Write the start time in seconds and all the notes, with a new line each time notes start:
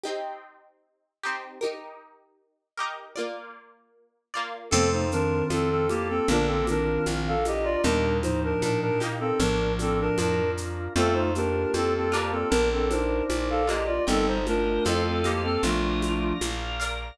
0.03 C4 D#4 G4
1.23 C4 D#4 G4
1.61 D#4 G4 A#4
2.77 D#4 G4 A#4
3.16 A#3 F4 D5
4.34 A#3 F4 D5
4.71 F2 C3 A3 C4 F4 A4, crash, low conga, shaker
4.92 D#4 C5
5.12 D#3 C4 D4 A#4, shaker
5.50 F2 C4 A4, high conga, shaker
5.70 C4 A4
5.89 A#3 G4, high conga, shaker
6.09 C4 A4
6.28 A#1 D3 A#3 D4 F4 A#4, low conga, shaker
6.32 D4
6.46 C4 A4
6.67 D#3 C4 D4 A#4, high conga, shaker
7.06 A#1, high conga, shaker
7.28 A4 F5
7.45 G4 D#5, high conga, shaker
7.64 F4 D5
7.83 D#2 A#2 G3 A#3 D4 D#4 G4 A#4, low conga, shaker
8.22 A2 F3 D#4 C5, high conga, shaker
8.44 D4 A#4
8.62 A#2 D4 A#4, high conga, shaker
8.81 D4 A#4
9.00 A#3 D#4 G4, high conga, shaker
9.20 C4 A4
9.39 A#1 A2 F3 D4 F4 A#4, low conga, shaker
9.79 C4 A4, high conga, shaker
10.00 D4 A#4
10.18 F2 D4 A#4, high conga, shaker
10.57 shaker
10.95 F2 A3 C4 F4 A4, low conga, shaker
11.14 D#4 C5
11.35 A#3 D4 G4 A#4, shaker
11.74 F2 C4 A4, high conga, shaker
11.95 C4 A4
12.12 A#3 D4 F4 G4, shaker
12.31 C4 A4
12.50 A#1 D4 F4 A#4, low conga, shaker
12.73 C4 A4
12.89 D4 D#4 A#4 C5, high conga, shaker
13.30 A#1, high conga, shaker
13.50 A4 F5
13.67 A#3 D4 F4 G4 D#5, high conga, shaker
13.86 F4 D5
14.07 G1 G3 C4 D#4 A4 A#4 D#5 G5 A#5, low conga, shaker
14.27 D#4 C5
14.46 A3 D4 F4 A#4, high conga, shaker
14.85 F2 C4 A4 C5 D#5 F5 A5 C6, high conga, shaker
14.89 A4
15.07 C4 A4
15.24 A#3 G4 C5 D#5 F5, high conga, shaker
15.28 A4
15.44 C4 A4
15.63 A#1 F3 A3 D4 F4 A#4 D5 F5 A#5, low conga, shaker
16.02 high conga, shaker
16.41 A#1, high conga, shaker
16.80 A#4 D5 F5, shaker